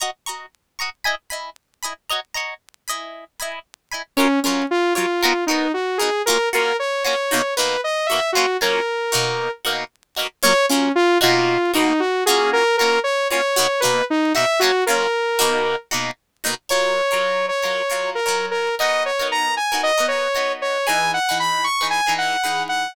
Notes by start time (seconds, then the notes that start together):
0.00 F#4 D#5 A#5 C#6
0.26 F#4 D#5 A#5 C#6
0.79 F#4 D#5 A#5 C#6
1.04 E4 D#5 G#5 B5
1.30 E4 D#5 G#5 B5
1.83 E4 D#5 G#5 B5
2.09 F#4 C#5 D#5 A#5
2.34 F#4 C#5 D#5 A#5
2.88 E4 D#5 G#5 B5
3.40 E4 D#5 G#5 B5
3.92 E4 D#5 G#5 B5
4.17 F#3 C#4 F4 A#4 C#5
4.43 F#3 C#4 F4 A#4 C#5
4.71 F4
4.95 F#3 F4 A#4 C#5
5.22 B3 D#4 F#4 A#4
5.47 D#4 F#4 A#4
5.51 B3
5.74 F#4
5.98 D#4 F#4 G#4 A#4
6.02 B3
6.26 A#3 C#4 F4 F#4 A#4
6.53 A#3 C#4 F4 F#4 A#4
6.79 C#5
7.04 A#3 C#4 F4 F#4 C#5
7.31 B2 A#3 D#4 F#4
7.57 B2 A#3 D#4 F#4 B4
7.84 D#5
8.06 F#4 E5
8.11 B2 A#3 D#4
8.32 C#4 F4 F#4
8.37 F#3 A#3
8.61 F#3 A#3 C#4 F4 A#4
9.12 B2 A#3 D#4 F#4
9.65 B2 A#3 D#4 F#4
10.16 B2 A#3 D#4 F#4
10.42 F#3 A#3 C#4 F4 C#5
10.69 F#3 A#3 C#4 F4
10.95 F4
11.21 B2 A#3 D#4 F4 F#4
11.74 B2 A#3 D#4 F#4
12.00 F#4
12.26 A#3 C#4 F4 F#4 G#4
12.53 A#4
12.77 C#4 F4 F#4 A#4
12.82 A#3
13.04 C#5
13.30 A#3 C#4 F4 F#4 C#5
13.56 B2 A#3 D#4 F#4
13.80 A#3 D#4 F#4 B4
13.85 B2
14.10 D#4
14.35 B2 A#3 D#4 F#4 E5
14.59 A#3 C#4 F4 F#4
14.64 F#3
14.86 F#3 A#3 C#4 F4 A#4
15.39 B2 A#3 D#4 F#4
15.91 B2 A#3 D#4 F#4
16.44 B2 A#3 D#4 F#4
16.69 F#3 F4 A#4 C#5
17.11 F#3 F4 A#4 C#5
17.48 C#5
17.62 F#3 F4 A#4 C#5
17.90 F#3 F4 A#4 C#5
18.15 A#4
18.26 F#3 F4 A#4 C#5
18.51 A#4
18.79 B3 D#4 F#4 A#4 D#5
19.06 C#5
19.19 B3 D#4 F#4 A#4
19.32 A#5
19.57 G#5
19.72 B3 D#4 F#4 A#4
19.83 D#5
19.97 B3 D#4 F#4 A#4
20.08 C#5
20.35 B3 D#4 F#4 A#4
20.62 C#5
20.87 E3 D#4 G#4 B4 G#5
21.14 F#5
21.29 E3 D#4 G#4 B4
21.40 B5
21.64 C#6
21.81 E3 D#4 G#4 B4
21.90 G#5
22.06 E3 D#4 G#4 B4
22.18 F#5
22.44 E3 D#4 G#4 B4
22.69 F#5